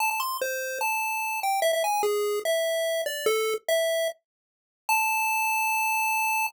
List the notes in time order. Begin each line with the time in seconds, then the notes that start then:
0.00 A5
0.11 A5
0.20 C6
0.41 C5
0.81 A5
1.43 G5
1.62 E5
1.73 E5
1.84 G#5
2.03 G#4
2.45 E5
3.06 D5
3.26 A4
3.68 E5
4.89 A5